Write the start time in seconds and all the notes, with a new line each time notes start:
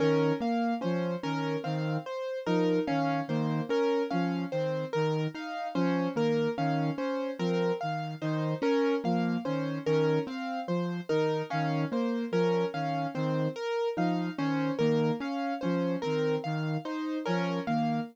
0.00 D#3 C#4 A#4
0.41 A#3 F5
0.81 F3 C#4 C5
1.23 D#3 C#4 A#4
1.64 D#3 C4 F5
2.06 C5
2.46 F3 D#4 A#4
2.87 D#3 C#4 F5
3.28 D#3 A#3 C5
3.69 C#4 A#4
4.10 F3 C#4 F5
4.52 D#3 C4 C5
4.93 D#3 A#4
5.34 D#4 F5
5.75 F3 C#4 C5
6.15 D#3 A#3 A#4
6.58 D#3 C#4 F5
6.98 C#4 C5
7.39 F3 C4 A#4
7.81 D#3 F5
8.22 D#3 D#4 C5
8.62 C#4 A#4
9.04 F3 A#3 F5
9.45 D#3 C#4 C5
9.86 D#3 C#4 A#4
10.27 C4 F5
10.68 F3 C5
11.09 D#3 D#4 A#4
11.50 D#3 C#4 F5
11.92 A#3 C5
12.32 F3 C#4 A#4
12.74 D#3 C#4 F5
13.15 D#3 C4 C5
13.56 A#4
13.97 F3 D#4 F5
14.38 D#3 C#4 C5
14.78 D#3 A#3 A#4
15.20 C#4 F5
15.61 F3 C#4 C5
16.02 D#3 C4 A#4
16.44 D#3 F5
16.85 D#4 C5
17.26 F3 C#4 A#4
17.67 D#3 A#3 F5